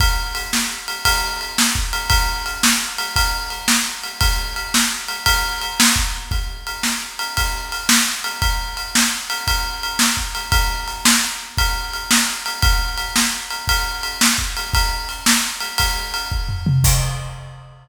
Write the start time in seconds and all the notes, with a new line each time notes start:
0.00 kick, ride
0.35 ride
0.53 snare
0.88 ride
1.05 kick, ride
1.41 ride
1.58 snare
1.75 kick
1.93 ride
2.10 kick, ride
2.46 ride
2.63 snare
2.98 ride
3.16 kick, ride
3.50 ride
3.68 snare
4.04 ride
4.21 kick, ride
4.56 ride
4.74 snare
5.08 ride
5.26 kick, ride
5.62 ride
5.80 snare
5.96 kick
6.31 kick, ride
6.67 ride
6.83 snare
7.19 ride
7.37 kick, ride
7.72 ride
7.89 snare
8.24 ride
8.42 kick, ride
8.77 ride
8.95 snare
9.30 ride
9.47 kick, ride
9.83 ride
9.99 snare
10.17 kick
10.35 ride
10.52 kick, ride
10.88 ride
11.05 snare
11.58 kick, ride
11.94 ride
12.11 snare
12.46 ride
12.62 kick, ride
12.98 ride
13.16 snare
13.51 ride
13.68 kick, ride
14.03 ride
14.21 snare
14.38 kick
14.57 ride
14.73 kick, ride
15.09 ride
15.26 snare
15.61 ride
15.78 kick, ride
16.14 ride
16.32 kick
16.49 floor tom
16.66 mid tom
16.84 kick, crash